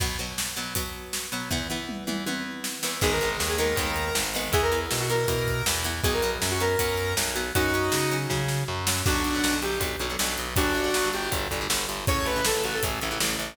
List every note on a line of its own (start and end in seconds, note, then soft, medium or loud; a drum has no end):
0.00 0.18 B2 loud
0.00 0.18 F#3 medium
0.00 0.18 B3 loud
0.00 kick medium
0.00 crash medium
0.19 0.54 B2 medium
0.19 0.54 F#3 medium
0.19 0.54 B3 medium
0.38 snare medium
0.56 0.74 B2 medium
0.56 0.74 F#3 medium
0.56 0.74 B3 medium
0.75 1.27 B2 medium
0.75 1.27 F#3 medium
0.75 1.27 B3 medium
0.75 kick medium
0.75 closed hi-hat loud
1.13 snare medium
1.32 1.49 B2 medium
1.32 1.49 F#3 medium
1.32 1.49 B3 medium
1.50 1.68 E2 medium
1.50 1.68 E3 loud
1.50 1.68 B3 loud
1.50 kick medium
1.50 floor tom medium
1.70 2.04 E2 medium
1.70 2.04 E3 medium
1.70 2.04 B3 medium
1.89 mid tom medium
2.07 2.24 E2 medium
2.07 2.24 E3 medium
2.07 2.24 B3 medium
2.07 mid tom medium
2.26 2.79 E2 medium
2.26 2.79 E3 medium
2.26 2.79 B3 medium
2.26 high tom medium
2.64 snare medium
2.83 3.00 E2 medium
2.83 3.00 E3 medium
2.83 3.00 B3 medium
2.83 snare medium
3.01 3.36 G#1 loud
3.01 3.19 D#3 loud
3.01 3.19 G#3 medium
3.01 3.19 B3 loud
3.01 3.11 G#4 loud
3.01 kick loud
3.01 crash medium
3.11 3.29 A#4 medium
3.21 3.56 D#3 medium
3.21 3.56 G#3 medium
3.21 3.56 B3 medium
3.21 closed hi-hat medium
3.40 3.74 D#2 medium
3.40 snare medium
3.49 3.58 G#4 medium
3.58 3.75 D#3 medium
3.58 3.75 G#3 medium
3.58 3.75 B3 medium
3.58 4.14 A#4 medium
3.58 closed hi-hat medium
3.76 4.10 D#2 medium
3.76 4.29 D#3 medium
3.76 4.29 G#3 medium
3.76 4.29 B3 medium
3.76 kick medium
3.76 closed hi-hat medium
3.96 closed hi-hat medium
4.15 4.49 G#1 medium
4.15 snare loud
4.34 4.52 D#3 medium
4.34 4.52 G#3 medium
4.34 4.52 B3 medium
4.34 open hi-hat medium
4.52 4.86 E2 loud
4.52 4.71 E3 loud
4.52 4.71 B3 loud
4.52 4.62 G#4 loud
4.52 kick loud
4.52 closed hi-hat medium
4.62 4.77 A#4 loud
4.72 5.06 E3 medium
4.72 5.06 B3 medium
4.72 closed hi-hat medium
4.91 5.26 B2 medium
4.91 snare loud
5.00 5.09 F#4 medium
5.09 5.27 E3 medium
5.09 5.27 B3 medium
5.09 5.64 A#4 medium
5.09 closed hi-hat medium
5.28 5.62 B2 medium
5.28 5.80 E3 medium
5.28 5.80 B3 medium
5.28 kick medium
5.28 closed hi-hat medium
5.47 kick medium
5.47 closed hi-hat medium
5.66 6.00 E2 medium
5.66 snare loud
5.84 6.02 E3 medium
5.84 6.02 B3 medium
5.84 closed hi-hat medium
6.04 6.37 B1 loud
6.04 6.22 F#3 loud
6.04 6.22 B3 loud
6.04 6.13 G#4 loud
6.04 kick loud
6.04 closed hi-hat medium
6.13 6.29 A#4 medium
6.22 6.57 F#3 medium
6.22 6.57 B3 medium
6.22 closed hi-hat medium
6.42 6.76 F#2 medium
6.42 snare loud
6.51 6.60 F#4 medium
6.60 6.78 F#3 medium
6.60 6.78 B3 medium
6.60 7.14 A#4 medium
6.60 closed hi-hat medium
6.79 7.14 F#2 medium
6.79 7.31 F#3 medium
6.79 7.31 B3 medium
6.79 kick medium
6.79 closed hi-hat loud
6.97 closed hi-hat medium
7.17 7.51 B1 medium
7.17 snare loud
7.36 7.53 F#3 medium
7.36 7.53 B3 medium
7.36 closed hi-hat medium
7.55 7.89 F#2 medium
7.55 7.72 F#3 loud
7.55 7.72 C#4 loud
7.55 8.15 D#4 medium
7.55 8.15 F#4 loud
7.55 kick medium
7.55 closed hi-hat medium
7.74 8.09 F#3 medium
7.74 8.09 C#4 loud
7.74 closed hi-hat medium
7.92 8.26 C#3 medium
7.92 snare loud
8.11 8.29 F#3 medium
8.11 8.29 C#4 medium
8.11 closed hi-hat medium
8.30 8.64 C#3 medium
8.30 8.83 F#3 medium
8.30 8.83 C#4 medium
8.30 kick medium
8.30 snare medium
8.48 snare medium
8.68 9.02 F#2 medium
8.87 9.05 F#3 medium
8.87 9.05 C#4 medium
8.87 snare loud
9.06 9.23 B1 medium
9.06 9.28 D3 medium
9.06 9.28 F#3 medium
9.06 9.28 B3 medium
9.06 9.54 D4 loud
9.06 9.54 F#4 loud
9.06 kick loud
9.06 crash loud
9.24 9.40 B1 medium
9.24 closed hi-hat medium
9.34 9.49 D3 medium
9.34 9.49 F#3 medium
9.34 9.49 B3 medium
9.44 9.60 B1 medium
9.44 snare loud
9.53 9.75 D3 medium
9.53 9.75 F#3 medium
9.53 9.75 B3 medium
9.62 9.78 B1 medium
9.62 9.78 G4 medium
9.62 closed hi-hat medium
9.80 9.96 B1 medium
9.80 9.95 D3 medium
9.80 9.95 F#3 medium
9.80 9.95 B3 medium
9.80 kick medium
9.80 closed hi-hat medium
10.00 10.16 B1 medium
10.00 10.07 D3 medium
10.00 10.07 F#3 medium
10.00 10.07 B3 medium
10.00 closed hi-hat medium
10.10 10.17 D3 medium
10.10 10.17 F#3 medium
10.10 10.17 B3 medium
10.19 10.36 B1 medium
10.19 10.49 D3 medium
10.19 10.49 F#3 medium
10.19 10.49 B3 medium
10.19 snare loud
10.38 10.54 B1 medium
10.38 closed hi-hat medium
10.56 10.72 G1 loud
10.56 10.79 D3 medium
10.56 10.79 G3 medium
10.56 11.08 D4 loud
10.56 11.08 F#4 loud
10.56 kick loud
10.56 closed hi-hat loud
10.74 10.90 G1 medium
10.74 closed hi-hat medium
10.84 10.99 D3 medium
10.84 10.99 G3 medium
10.94 11.11 G1 medium
10.94 snare loud
11.04 11.27 D3 medium
11.04 11.27 G3 medium
11.13 11.30 G1 medium
11.13 11.30 G4 medium
11.13 closed hi-hat medium
11.31 11.47 G1 medium
11.31 11.47 D3 medium
11.31 11.47 G3 medium
11.31 kick medium
11.31 closed hi-hat medium
11.51 11.67 G1 medium
11.51 11.59 D3 medium
11.51 11.59 G3 medium
11.51 kick medium
11.51 closed hi-hat medium
11.61 11.68 D3 medium
11.61 11.68 G3 medium
11.69 11.86 G1 medium
11.69 12.00 D3 medium
11.69 12.00 G3 medium
11.69 snare loud
11.89 12.05 G1 medium
11.89 closed hi-hat medium
12.07 12.24 A1 medium
12.07 12.31 C#3 medium
12.07 12.31 E3 medium
12.07 12.31 A3 medium
12.07 12.25 C#5 loud
12.07 kick loud
12.07 closed hi-hat medium
12.25 12.41 A1 medium
12.25 12.42 B4 loud
12.25 closed hi-hat medium
12.36 12.51 C#3 medium
12.36 12.51 E3 medium
12.36 12.51 A3 medium
12.45 12.62 A1 medium
12.45 12.63 A4 loud
12.45 snare loud
12.55 12.78 C#3 medium
12.55 12.78 E3 medium
12.55 12.78 A3 medium
12.64 12.80 A1 medium
12.64 12.73 F#4 medium
12.64 closed hi-hat medium
12.74 12.83 A4 medium
12.83 12.99 A1 medium
12.83 12.98 C#3 medium
12.83 12.98 E3 medium
12.83 12.98 A3 medium
12.83 kick medium
12.83 closed hi-hat loud
13.01 13.19 A1 medium
13.01 13.09 C#3 medium
13.01 13.09 E3 medium
13.01 13.09 A3 medium
13.01 closed hi-hat medium
13.11 13.18 C#3 medium
13.11 13.18 E3 medium
13.11 13.18 A3 medium
13.20 13.36 A1 medium
13.20 13.51 C#3 medium
13.20 13.51 E3 medium
13.20 13.51 A3 medium
13.20 snare loud
13.39 13.55 A1 medium
13.39 closed hi-hat medium